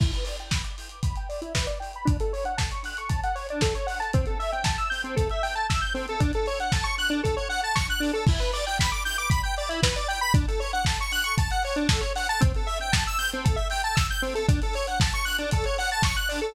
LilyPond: <<
  \new Staff \with { instrumentName = "Lead 1 (square)" } { \time 4/4 \key e \minor \tempo 4 = 116 e'16 b'16 d''16 g''16 b''16 d'''16 g'''16 d'''16 b''16 g''16 d''16 e'16 b'16 d''16 g''16 b''16 | d'16 a'16 cis''16 fis''16 a''16 cis'''16 fis'''16 cis'''16 a''16 fis''16 cis''16 d'16 a'16 cis''16 fis''16 a''16 | c'16 a'16 e''16 g''16 a''16 e'''16 g'''16 c'16 a'16 e''16 g''16 a''16 e'''16 g'''16 c'16 a'16 | d'16 a'16 cis''16 fis''16 a''16 cis'''16 fis'''16 d'16 a'16 cis''16 fis''16 a''16 cis'''16 fis'''16 d'16 a'16 |
e'16 b'16 d''16 g''16 b''16 d'''16 g'''16 d'''16 b''16 g''16 d''16 e'16 b'16 d''16 g''16 b''16 | d'16 a'16 cis''16 fis''16 a''16 cis'''16 fis'''16 cis'''16 a''16 fis''16 cis''16 d'16 a'16 cis''16 fis''16 a''16 | c'16 a'16 e''16 g''16 a''16 e'''16 g'''16 c'16 a'16 e''16 g''16 a''16 e'''16 g'''16 c'16 a'16 | d'16 a'16 cis''16 fis''16 a''16 cis'''16 fis'''16 d'16 a'16 cis''16 fis''16 a''16 cis'''16 fis'''16 d'16 a'16 | }
  \new DrumStaff \with { instrumentName = "Drums" } \drummode { \time 4/4 <cymc bd>16 hh16 hho16 hh16 <bd sn>16 hh16 hho16 hh16 <hh bd>16 hh16 hho16 hh16 <bd sn>16 hh16 hho16 hh16 | <hh bd>16 hh16 hho16 hh16 <bd sn>16 hh16 hho16 hh16 <hh bd>16 hh16 hho16 hh16 <bd sn>16 hh16 hho16 hh16 | <hh bd>16 hh16 hho16 hh16 <bd sn>16 hh16 hho16 hh16 <hh bd>16 hh16 hho16 hh16 <bd sn>16 hh16 hho16 hh16 | <hh bd>16 hh16 hho16 hh16 <bd sn>16 hh16 hho16 hh16 <hh bd>16 hh16 hho16 hh16 <bd sn>16 hh16 hho16 hh16 |
<cymc bd>16 hh16 hho16 hh16 <bd sn>16 hh16 hho16 hh16 <hh bd>16 hh16 hho16 hh16 <bd sn>16 hh16 hho16 hh16 | <hh bd>16 hh16 hho16 hh16 <bd sn>16 hh16 hho16 hh16 <hh bd>16 hh16 hho16 hh16 <bd sn>16 hh16 hho16 hh16 | <hh bd>16 hh16 hho16 hh16 <bd sn>16 hh16 hho16 hh16 <hh bd>16 hh16 hho16 hh16 <bd sn>16 hh16 hho16 hh16 | <hh bd>16 hh16 hho16 hh16 <bd sn>16 hh16 hho16 hh16 <hh bd>16 hh16 hho16 hh16 <bd sn>16 hh16 hho16 hh16 | }
>>